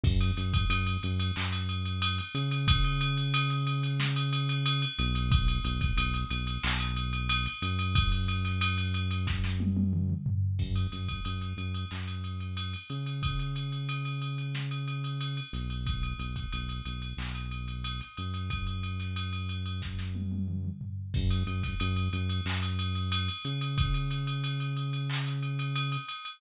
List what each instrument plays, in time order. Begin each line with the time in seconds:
0.04 synth bass 1 F#2, kick, crash
0.21 ride
0.37 synth bass 1 F#2, snare, ride
0.54 kick, ride
0.69 synth bass 1 F#2, ride
0.87 ride
1.03 synth bass 1 F#2, ride
1.20 ride
1.36 synth bass 1 F#2, clap
1.52 ride
1.69 ride
1.85 ride
2.02 ride
2.18 ride
2.34 synth bass 1 C#3, ride
2.51 ride
2.68 kick, ride
2.84 ride
3.01 ride
3.17 ride
3.34 ride
3.50 ride
3.67 ride
3.83 ride
4.00 snare
4.16 ride
4.33 ride
4.49 ride
4.66 ride
4.82 ride
4.98 synth bass 1 B1, snare, ride
5.15 ride
5.32 kick, ride
5.48 ride
5.64 synth bass 1 B1, ride
5.81 kick, ride
5.97 synth bass 1 B1, ride
6.14 ride
6.30 synth bass 1 B1, ride
6.47 ride
6.63 synth bass 1 B1, clap
6.80 ride
6.96 ride
7.13 ride
7.29 ride
7.46 ride
7.62 synth bass 1 F#2, ride
7.79 ride
7.95 kick, ride
8.12 ride
8.28 ride
8.45 snare, ride
8.61 ride
8.78 ride
8.94 ride
9.11 ride
9.27 kick, snare
9.44 snare
9.60 high tom
9.77 high tom
9.93 mid tom
10.10 mid tom
10.26 floor tom
10.59 synth bass 1 F#2, kick, crash
10.76 ride
10.92 synth bass 1 F#2, snare, ride
11.09 kick, ride
11.25 synth bass 1 F#2, ride
11.41 ride
11.57 synth bass 1 F#2, ride
11.74 ride
11.91 synth bass 1 F#2, clap
12.07 ride
12.24 ride
12.40 ride
12.57 ride
12.73 ride
12.90 synth bass 1 C#3, ride
13.06 ride
13.23 kick, ride
13.39 ride
13.56 ride
13.72 ride
13.89 ride
14.05 ride
14.22 ride
14.38 ride
14.55 snare
14.71 ride
14.88 ride
15.04 ride
15.21 ride
15.37 ride
15.53 synth bass 1 B1, snare, ride
15.70 ride
15.87 kick, ride
16.03 ride
16.18 synth bass 1 B1, ride
16.36 kick, ride
16.52 synth bass 1 B1, ride
16.69 ride
16.85 synth bass 1 B1, ride
17.02 ride
17.17 synth bass 1 B1, clap
17.35 ride
17.51 ride
17.68 ride
17.84 ride
18.01 ride
18.17 synth bass 1 F#2, ride
18.34 ride
18.50 kick, ride
18.67 ride
18.83 ride
19.00 snare, ride
19.16 ride
19.33 ride
19.49 ride
19.66 ride
19.82 kick, snare
19.99 snare
20.15 high tom
20.32 high tom
20.48 mid tom
20.65 mid tom
20.81 floor tom
21.14 synth bass 1 F#2, kick, crash
21.30 ride
21.47 synth bass 1 F#2, ride
21.63 kick, snare, ride
21.80 synth bass 1 F#2, ride
21.96 ride
22.13 synth bass 1 F#2, ride
22.29 ride
22.45 synth bass 1 F#2, clap
22.62 ride
22.79 ride
22.95 ride
23.12 ride
23.28 ride
23.45 synth bass 1 C#3, ride
23.61 ride
23.78 kick, ride
23.94 ride
24.11 ride
24.27 ride
24.44 ride
24.60 ride
24.77 ride
24.93 ride
25.10 clap
25.26 ride
25.43 ride
25.59 ride
25.76 ride
25.92 ride
26.09 ride
26.25 ride